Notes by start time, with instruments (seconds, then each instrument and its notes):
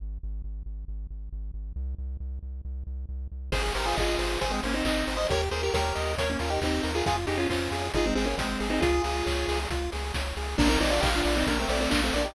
0.00 synth bass 1 G#1
0.23 synth bass 1 G#1
0.44 synth bass 1 G#1
0.66 synth bass 1 G#1
0.88 synth bass 1 G#1
1.10 synth bass 1 G#1
1.33 synth bass 1 G#1
1.54 synth bass 1 G#1
1.76 synth bass 1 C2
1.98 synth bass 1 C2
2.20 synth bass 1 C2
2.43 synth bass 1 C2
2.65 synth bass 1 C2
2.87 synth bass 1 C2
3.09 synth bass 1 C2
3.32 synth bass 1 C2
3.52 synth bass 1 G#1, lead 1 (square) G#4 C5, kick, crash
3.74 synth bass 1 G#1, lead 1 (square) G4 A#4 C5, open hi-hat
3.86 lead 1 (square) F4 G#4
3.96 synth bass 1 G#1, lead 1 (square) F4 G#4 D#5, kick, clap
4.18 synth bass 1 G#1, lead 1 (square) C5, open hi-hat
4.41 synth bass 1 G#1, lead 1 (square) G#4 C5, kick, closed hi-hat
4.50 lead 1 (square) G#3 C4
4.63 synth bass 1 G#1, lead 1 (square) A#3 C#4 C5, open hi-hat
4.74 lead 1 (square) C4 D#4
4.85 synth bass 1 G#1, lead 1 (square) C4 D#4 D#5, kick, clap
5.07 synth bass 1 G#1, lead 1 (square) C5, open hi-hat
5.17 lead 1 (square) C5 D#5
5.30 synth bass 1 D#2, lead 1 (square) G4 A#4 C#5, kick, closed hi-hat
5.51 synth bass 1 D#2, lead 1 (square) G#4 A#4 C5, open hi-hat
5.63 lead 1 (square) G4 A#4
5.74 synth bass 1 D#2, lead 1 (square) G4 A#4 C#5, kick, snare
5.95 synth bass 1 D#2, lead 1 (square) D#5, open hi-hat
6.18 synth bass 1 D#2, lead 1 (square) A#4 C#5, kick, closed hi-hat
6.30 lead 1 (square) A#3 C#4
6.39 synth bass 1 D#2, lead 1 (square) C#4 F4 A#4, open hi-hat
6.50 lead 1 (square) D#4 G4
6.61 synth bass 1 D#2, lead 1 (square) C4 D#4 G4, kick, clap
6.83 synth bass 1 D#2, lead 1 (square) A#4, open hi-hat
6.95 lead 1 (square) F4 G#4
7.06 synth bass 1 F2, lead 1 (square) F4 G#4, kick, closed hi-hat
7.27 synth bass 1 F2, lead 1 (square) D#4 G4 G#4, open hi-hat
7.38 lead 1 (square) C#4 F4
7.50 synth bass 1 F2, lead 1 (square) C#4 F4 C5, kick, clap
7.71 synth bass 1 F2, lead 1 (square) G#4, open hi-hat
7.94 synth bass 1 G#1, lead 1 (square) D#4 F4 G#4, kick, closed hi-hat
8.06 lead 1 (square) G#3 C4
8.15 synth bass 1 G#1, lead 1 (square) G#3 C4 G#4, open hi-hat
8.25 lead 1 (square) A#3 C#4
8.37 synth bass 1 G#1, lead 1 (square) G#3 C4 C5, kick, snare
8.60 synth bass 1 G#1, lead 1 (square) G#4, open hi-hat
8.70 lead 1 (square) C4 D#4
8.81 synth bass 1 C#2, lead 1 (square) F4 G#4, kick, closed hi-hat
9.04 synth bass 1 C#2, lead 1 (square) G#4, open hi-hat
9.26 synth bass 1 C#2, lead 1 (square) C#5, kick, clap
9.48 synth bass 1 C#2, lead 1 (square) G#4, open hi-hat
9.70 synth bass 1 C#2, lead 1 (square) F4, kick, closed hi-hat
9.92 synth bass 1 C#2, lead 1 (square) G#4, open hi-hat
10.14 synth bass 1 C#2, lead 1 (square) C#5, kick, snare
10.37 synth bass 1 C#2, lead 1 (square) G#4, open hi-hat
10.58 synth bass 1 A#1, lead 1 (square) A#3 D4 A#4, kick, crash
10.69 lead 1 (square) C4 D#4
10.81 synth bass 1 A#1, lead 1 (square) C4 D#4 D5, open hi-hat
10.91 lead 1 (square) D4 F4
11.01 synth bass 1 A#1, lead 1 (square) D#4 G4 F5, kick, clap
11.15 lead 1 (square) D4 F4
11.25 synth bass 1 A#1, lead 1 (square) D5, open hi-hat
11.37 lead 1 (square) C4 D#4
11.46 synth bass 1 A#1, lead 1 (square) A#3 D4 A#4, kick, closed hi-hat
11.59 lead 1 (square) A3 C4
11.69 synth bass 1 A#1, lead 1 (square) A3 C4 D5, open hi-hat
11.81 lead 1 (square) A3 C4
11.90 synth bass 1 A#1, lead 1 (square) A#3 D4 F5, kick, clap
12.04 lead 1 (square) A3 C4
12.13 synth bass 1 A#1, lead 1 (square) A#3 D4 D5, open hi-hat
12.25 lead 1 (square) D#4 G4